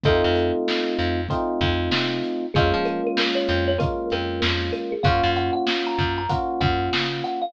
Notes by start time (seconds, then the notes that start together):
0.04 F2 A3 C4 D#4 F4 A4, kick, closed hi-hat
0.24 F2
0.36 closed hi-hat
0.68 snare
0.99 F2, closed hi-hat
1.29 A3 C4 D#4 F4, kick, closed hi-hat
1.61 F2, kick, closed hi-hat
1.91 C3, snare
2.24 closed hi-hat
2.54 F2 G#3 A#3 C#4 F4 G#4, kick, closed hi-hat
2.74 F3
2.85 A#4, closed hi-hat
3.07 A#4
3.17 snare
3.35 C#5
3.48 F2, closed hi-hat
3.68 C#5
3.78 G#3 A#3 C#4 F4 A#4, kick, closed hi-hat
4.10 F2 A#4, closed hi-hat
4.42 F2, snare
4.73 A#4, closed hi-hat
4.92 G#4
5.03 F#2 A#3 C#4 F4 F#4 F5, kick, closed hi-hat
5.23 F#2
5.36 F#5, closed hi-hat
5.53 F#5
5.67 snare
5.87 A#5
5.98 F#2, kick, closed hi-hat
6.18 A#5
6.29 A#3 C#4 F4 F#4 F#5, kick, closed hi-hat
6.61 F#2 F#5, kick, closed hi-hat
6.93 C#3, snare
7.24 F#5, closed hi-hat
7.42 F5